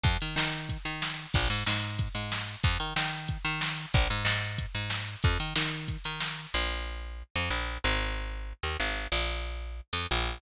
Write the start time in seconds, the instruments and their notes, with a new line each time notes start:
0.04 electric bass (finger) F2, kick, closed hi-hat
0.21 electric bass (finger) D#3, closed hi-hat
0.36 electric bass (finger) D#3, snare
0.54 closed hi-hat
0.69 kick, closed hi-hat
0.85 electric bass (finger) D#3, closed hi-hat
1.02 snare
1.19 closed hi-hat
1.34 electric bass (finger) A#1, kick, crash
1.50 electric bass (finger) G#2, closed hi-hat
1.66 electric bass (finger) G#2, snare
1.84 closed hi-hat
1.99 kick, closed hi-hat
2.15 electric bass (finger) G#2, closed hi-hat
2.32 snare
2.48 closed hi-hat
2.63 electric bass (finger) F2, kick, closed hi-hat
2.80 electric bass (finger) D#3, closed hi-hat
2.96 electric bass (finger) D#3, snare
3.13 closed hi-hat
3.28 kick, closed hi-hat
3.45 electric bass (finger) D#3, closed hi-hat
3.61 snare
3.77 closed hi-hat
3.94 electric bass (finger) A#1, kick, closed hi-hat
4.10 electric bass (finger) G#2, closed hi-hat
4.25 electric bass (finger) G#2, snare
4.43 closed hi-hat
4.58 kick, closed hi-hat
4.75 electric bass (finger) G#2, closed hi-hat
4.90 snare
5.08 closed hi-hat
5.23 electric bass (finger) F2, kick, closed hi-hat
5.39 electric bass (finger) D#3, closed hi-hat
5.56 electric bass (finger) D#3, snare
5.72 closed hi-hat
5.88 kick, closed hi-hat
6.04 electric bass (finger) D#3, closed hi-hat
6.20 snare
6.36 closed hi-hat
6.54 electric bass (finger) A#1
7.36 electric bass (finger) F2
7.50 electric bass (finger) A#1
7.84 electric bass (finger) G#1
8.63 electric bass (finger) D#2
8.80 electric bass (finger) G#1
9.12 electric bass (finger) A#1
9.93 electric bass (finger) F2
10.11 electric bass (finger) A#1